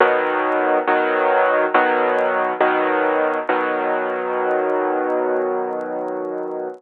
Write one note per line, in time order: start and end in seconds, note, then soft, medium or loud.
0.00 0.79 B2 loud
0.00 0.79 D#3 loud
0.00 0.79 F#3 loud
0.87 1.66 B2 medium
0.87 1.66 D#3 loud
0.87 1.66 F#3 loud
1.74 2.53 B2 loud
1.74 2.53 D#3 medium
1.74 2.53 F#3 loud
2.61 3.39 B2 loud
2.61 3.39 D#3 loud
2.61 3.39 F#3 loud
3.49 6.68 B2 loud
3.49 6.68 D#3 medium
3.49 6.68 F#3 loud